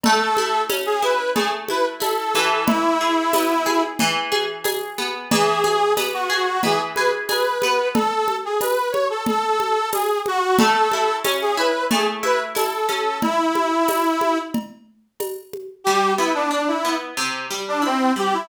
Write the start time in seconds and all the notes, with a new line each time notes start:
0.03 A3 A4, cowbell, low conga
0.37 E4, high conga
0.69 C#4, tambourine, cowbell, high conga
0.86 G#4
1.02 E4 B4, high conga
1.35 A3 G#4, cowbell, low conga
1.68 E4 B4, high conga
2.00 E4 A4, tambourine, cowbell, high conga
2.35 E3, high conga
2.66 E4, cowbell, low conga
3.01 G#4
3.33 B3, tambourine, cowbell, high conga
3.66 G#4, high conga
3.99 E3, cowbell, low conga
4.32 G#4, high conga
4.64 G#4, tambourine, cowbell, high conga
4.98 B3, high conga
5.30 E3 G#4, cowbell, low conga
5.64 G#4, high conga
5.97 B3, tambourine, cowbell, high conga
6.14 F#4
6.30 F#4 G#4
6.63 E3 G#4, cowbell, low conga
6.95 G#4 B4, high conga
7.29 G#4 B4, tambourine, cowbell, high conga
7.62 B3, high conga
7.94 A4, cowbell, low conga
8.28 high conga
8.45 G#4
8.61 B4, tambourine, cowbell, high conga
8.92 C#5, high conga
9.10 A4
9.26 A4, cowbell, low conga
9.60 high conga
9.92 G#4, tambourine, cowbell, high conga
10.26 F#4, high conga
10.59 A3 A4, cowbell, low conga
10.92 E4, high conga
11.24 C#4, tambourine, cowbell, high conga
11.41 G#4
11.57 E4 B4
11.91 A3 G#4, cowbell, low conga
12.23 E4 B4, high conga
12.55 E4 A4, tambourine, cowbell, high conga
12.89 C#4, high conga
13.22 E4, cowbell, low conga
13.55 high conga
13.88 tambourine, cowbell, high conga
14.21 high conga
14.54 cowbell, low conga
15.20 tambourine, cowbell, high conga
15.53 high conga
15.84 G3 G4
16.18 B3 E4
16.34 D4
16.51 D4
16.68 E4
16.85 B3
17.17 C3
17.51 G3
17.68 D4
17.82 C4 E4
18.16 G3 G4
18.33 E4